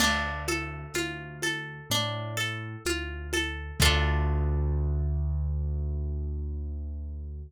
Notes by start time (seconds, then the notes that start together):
0.00 D2 D4, crash, low conga, shaker
0.48 A4, high conga, shaker
0.94 D2 F4, high conga, shaker
1.42 A4, high conga, shaker
1.90 A2 D4, low conga, shaker
2.37 A4, shaker
2.85 D2 F4, high conga, shaker
3.33 A4, high conga, shaker
3.80 D2 D4 F4 A4, kick, crash